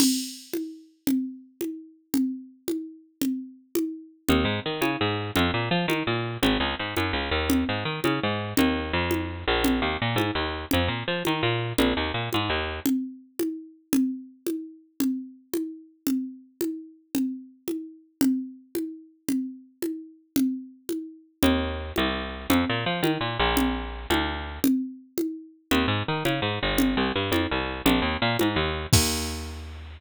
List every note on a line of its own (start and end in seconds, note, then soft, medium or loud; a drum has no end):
0.00 crash medium
0.00 low conga loud
0.53 high conga medium
1.07 low conga medium
1.61 high conga medium
2.14 low conga medium
2.68 high conga medium
3.22 low conga medium
3.75 high conga medium
4.28 4.44 D#2 loud
4.28 low conga medium
4.45 4.60 G#2 medium
4.66 4.81 D#3 medium
4.81 4.97 C#3 medium
4.81 high conga medium
5.01 5.31 G#2 medium
5.36 5.51 F2 loud
5.36 low conga medium
5.54 5.69 A#2 medium
5.71 5.86 F3 medium
5.88 6.03 D#3 medium
5.88 high conga medium
6.07 6.37 A#2 medium
6.42 6.58 G#1 loud
6.42 low conga medium
6.60 6.75 C#2 medium
6.79 6.95 G#2 medium
6.97 7.12 F#2 medium
6.97 high conga medium
7.13 7.30 C#2 medium
7.31 7.64 D#2 loud
7.50 low conga medium
7.69 7.84 G#2 medium
7.85 8.00 D#3 medium
8.04 8.20 C#3 medium
8.04 high conga medium
8.23 8.54 G#2 medium
8.57 8.92 D#2 loud
8.57 low conga loud
8.93 9.44 F2 loud
9.11 high conga medium
9.48 9.81 A#1 loud
9.64 low conga medium
9.82 9.97 D#2 medium
10.02 10.17 A#2 medium
10.16 10.31 G#2 medium
10.16 high conga medium
10.35 10.65 D#2 medium
10.71 10.88 F2 medium
10.71 low conga medium
10.88 11.03 A#2 medium
11.08 11.23 F3 medium
11.25 11.42 D#3 medium
11.25 high conga medium
11.43 11.73 A#2 medium
11.78 11.94 A#1 loud
11.78 low conga medium
11.97 12.12 D#2 medium
12.14 12.29 A#2 medium
12.33 12.49 G#2 medium
12.33 high conga medium
12.50 12.80 D#2 medium
12.86 low conga medium
13.39 high conga medium
13.93 low conga loud
14.47 high conga medium
15.00 low conga medium
15.54 high conga medium
16.07 low conga medium
16.61 high conga medium
17.15 low conga medium
17.68 high conga medium
18.21 low conga loud
18.75 high conga medium
19.28 low conga medium
19.82 high conga medium
20.36 low conga medium
20.89 high conga medium
21.43 21.92 D#2 loud
21.43 low conga loud
21.96 22.47 C2 medium
21.96 high conga medium
22.50 22.65 F2 loud
22.50 low conga loud
22.69 22.85 A#2 medium
22.86 23.01 F3 medium
23.03 23.18 D#3 medium
23.03 high conga medium
23.21 23.38 A#2 medium
23.39 24.07 A#1 loud
23.57 low conga medium
24.10 24.59 D2 loud
24.10 high conga medium
24.64 low conga loud
25.18 high conga medium
25.71 25.86 D#2 loud
25.71 low conga medium
25.88 26.03 G#2 medium
26.08 26.24 D#3 medium
26.25 26.40 C#3 medium
26.25 high conga medium
26.42 26.59 G#2 medium
26.63 26.96 G1 loud
26.78 low conga loud
26.97 27.12 C2 medium
27.16 27.31 G2 medium
27.32 27.47 F2 medium
27.32 high conga medium
27.51 27.82 C2 medium
27.86 28.01 A#1 loud
27.86 low conga loud
28.02 28.17 D#2 medium
28.22 28.37 A#2 loud
28.39 28.56 G#2 medium
28.39 high conga medium
28.56 28.87 D#2 loud
28.93 29.98 D#2 loud
28.93 kick loud
28.93 crash loud